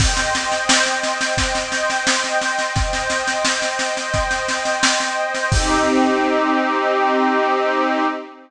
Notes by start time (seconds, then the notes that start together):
0.00 C5 D#5 G5, kick, snare, crash
0.17 snare
0.35 snare
0.52 snare
0.69 snare
0.86 snare
1.03 snare
1.21 snare
1.37 kick, snare
1.55 snare
1.72 snare
1.90 snare
2.07 snare
2.24 snare
2.42 snare
2.59 snare
2.76 C5 D#5 G5, kick, snare
2.93 snare
3.10 snare
3.28 snare
3.45 snare
3.62 snare
3.79 snare
3.97 snare
4.14 kick, snare
4.31 snare
4.48 snare
4.65 snare
4.83 snare
5.00 snare
5.34 snare
5.51 C4 D#4 G4, kick, crash